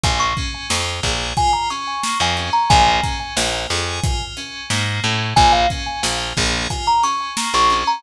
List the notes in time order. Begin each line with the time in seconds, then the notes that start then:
0.03 A#1 A#3 G#5, kick, closed hi-hat
0.20 C#6
0.37 C#4, kick, closed hi-hat
0.69 F2 F4, snare
1.03 A#1 G#4, kick, snare, closed hi-hat
1.37 F4 G#5, kick, closed hi-hat
1.53 A#5
1.70 C#4 C#6, closed hi-hat
2.03 A#3, snare
2.20 F2 G#5
2.37 C#4, closed hi-hat
2.53 A#5
2.70 A#1 A#3 G#5, kick, closed hi-hat
3.03 C#4, kick, closed hi-hat
3.37 A#1 F4, snare
3.69 F2 G#4, snare, closed hi-hat
4.03 F4, kick, closed hi-hat
4.37 C#4, closed hi-hat
4.70 G#2 A#3, snare
5.03 A2 C#4, closed hi-hat
5.36 A#1 A#3 G#5, kick, closed hi-hat
5.52 F5
5.70 C#4, kick, closed hi-hat
6.03 A#1 F4, snare
6.37 A#1 G#4, kick, snare, closed hi-hat
6.70 F4 G#5, kick, closed hi-hat
6.87 A#5
7.02 C#4 C#6, closed hi-hat
7.37 A#3, snare
7.54 A#1 C#6
7.70 C#4, closed hi-hat
7.87 A#5